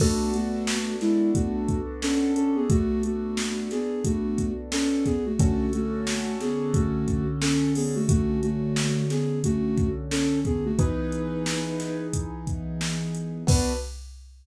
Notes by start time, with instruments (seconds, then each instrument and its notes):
0.00 ocarina A3 F#4, acoustic grand piano B3 D4 F#4 A4, kick, crash
0.34 ocarina A3 F#4, closed hi-hat
0.67 snare
1.01 ocarina G#3 E4, snare, closed hi-hat
1.35 ocarina A3 F#4, kick, closed hi-hat
1.69 kick, closed hi-hat
2.02 ocarina C#4 A4, snare
2.36 ocarina C#4 A4, closed hi-hat
2.56 ocarina B3 G#4
2.70 ocarina A3 F#4, kick, closed hi-hat
3.03 ocarina A3 F#4, closed hi-hat
3.37 snare
3.71 ocarina B3 G#4, snare, closed hi-hat
4.04 ocarina A3 F#4, kick, closed hi-hat
4.38 kick, closed hi-hat
4.72 ocarina C#4 A4, snare
5.05 ocarina B3 G#4, kick, snare, closed hi-hat
5.26 ocarina A3 F#4
5.39 acoustic grand piano D3 C#4 F#4 A4, ocarina A3 F#4, kick, closed hi-hat
5.73 ocarina A3 F#4, closed hi-hat
6.07 snare
6.40 ocarina B3 G#4, snare, closed hi-hat
6.74 ocarina A3 F#4, kick, closed hi-hat
7.08 kick, closed hi-hat
7.41 ocarina C#4 A4, snare
7.75 ocarina B3 G#4, open hi-hat
7.95 ocarina A3 F#4
8.09 ocarina A3 F#4, kick, closed hi-hat
8.43 ocarina A3 F#4, closed hi-hat
8.76 snare
9.10 ocarina B3 G#4, snare, closed hi-hat
9.44 ocarina A3 F#4, kick, closed hi-hat
9.78 kick, closed hi-hat
10.11 ocarina C#4 A4, snare
10.45 ocarina B3 G#4, kick, closed hi-hat
10.65 ocarina A3 F#4
10.78 acoustic grand piano E3 B3 D#4 G#4, ocarina D#4 B4, kick, closed hi-hat
11.12 closed hi-hat
11.46 snare
11.80 snare, closed hi-hat
12.13 kick, closed hi-hat
12.47 kick, closed hi-hat
12.81 snare
13.15 closed hi-hat
13.47 acoustic grand piano B3 D4 F#4 A4, ocarina B4, kick, crash